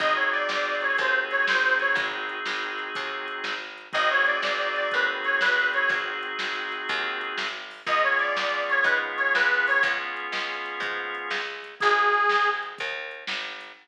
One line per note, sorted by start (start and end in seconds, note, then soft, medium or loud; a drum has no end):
0.00 0.44 G#1 loud
0.00 3.54 C4 loud
0.00 3.54 D#4 loud
0.00 3.54 F#4 loud
0.00 3.54 G#4 loud
0.00 0.15 D#5 loud
0.00 kick medium
0.00 closed hi-hat medium
0.16 0.30 C#5 medium
0.32 0.76 D5 loud
0.32 closed hi-hat medium
0.49 0.93 G#1 loud
0.49 snare medium
0.81 0.96 C#5 medium
0.81 closed hi-hat medium
0.98 1.43 D#2 loud
0.98 1.14 C5 medium
0.98 kick medium
0.98 closed hi-hat medium
1.31 1.45 C#5 loud
1.31 closed hi-hat medium
1.47 1.93 G#1 medium
1.47 1.74 C5 medium
1.47 snare loud
1.80 1.95 C#5 loud
1.80 closed hi-hat medium
1.95 2.40 G#1 loud
1.95 kick loud
1.95 closed hi-hat medium
2.29 closed hi-hat medium
2.45 2.90 G#1 medium
2.45 snare medium
2.79 closed hi-hat medium
2.95 3.40 D#2 loud
2.95 kick medium
2.95 closed hi-hat loud
3.28 closed hi-hat medium
3.44 3.88 G#1 medium
3.44 snare medium
3.78 closed hi-hat medium
3.93 4.39 G#1 loud
3.93 7.47 C4 loud
3.93 7.47 D#4 loud
3.93 7.47 F#4 loud
3.93 7.47 G#4 loud
3.93 4.10 D#5 loud
3.93 kick medium
3.93 closed hi-hat medium
4.11 4.25 C#5 loud
4.26 4.75 D5 medium
4.26 closed hi-hat medium
4.42 4.87 G#1 medium
4.42 snare medium
4.76 4.89 D5 loud
4.76 closed hi-hat medium
4.91 5.38 D#2 loud
4.91 5.07 B4 medium
4.91 kick medium
4.91 closed hi-hat medium
5.24 5.38 C#5 loud
5.24 closed hi-hat medium
5.41 5.86 G#1 loud
5.41 5.68 B4 loud
5.41 snare medium
5.73 5.90 C#5 loud
5.73 closed hi-hat medium
5.89 6.33 G#1 medium
5.89 kick medium
5.89 closed hi-hat medium
6.23 closed hi-hat medium
6.39 6.84 G#1 medium
6.39 snare medium
6.72 closed hi-hat medium
6.89 7.33 D#2 loud
6.89 kick medium
6.89 closed hi-hat medium
7.21 closed hi-hat medium
7.38 7.82 G#1 medium
7.38 snare medium
7.71 open hi-hat medium
7.87 8.31 C#2 loud
7.87 11.41 B3 loud
7.87 11.41 C#4 loud
7.87 11.41 F4 loud
7.87 11.41 G#4 loud
7.87 8.03 D#5 loud
7.87 kick medium
7.87 closed hi-hat medium
8.03 8.18 C#5 loud
8.19 8.65 D5 loud
8.19 closed hi-hat medium
8.37 8.81 C#2 medium
8.37 snare medium
8.69 8.83 C#5 loud
8.69 closed hi-hat medium
8.84 9.28 G#2 loud
8.84 8.98 B4 medium
8.84 kick medium
8.84 closed hi-hat medium
9.17 9.33 C#5 loud
9.17 closed hi-hat medium
9.35 9.79 C#2 loud
9.35 9.66 B4 loud
9.35 snare medium
9.67 9.82 C#5 loud
9.67 open hi-hat medium
9.83 10.27 C#2 loud
9.83 kick medium
9.83 closed hi-hat loud
10.17 closed hi-hat medium
10.32 10.77 C#2 medium
10.32 snare medium
10.66 closed hi-hat medium
10.80 11.24 G#2 loud
10.80 kick medium
10.80 closed hi-hat medium
11.15 closed hi-hat medium
11.30 11.75 C#2 medium
11.30 snare medium
11.64 closed hi-hat medium
11.80 12.26 G#1 loud
11.80 12.49 G#4 loud
11.80 kick medium
11.80 closed hi-hat medium
12.13 closed hi-hat medium
12.29 12.75 G#1 medium
12.29 snare medium
12.63 closed hi-hat medium
12.78 13.24 D#2 loud
12.78 kick medium
12.78 closed hi-hat medium
13.11 closed hi-hat medium
13.27 13.72 G#1 medium
13.27 snare medium
13.61 closed hi-hat medium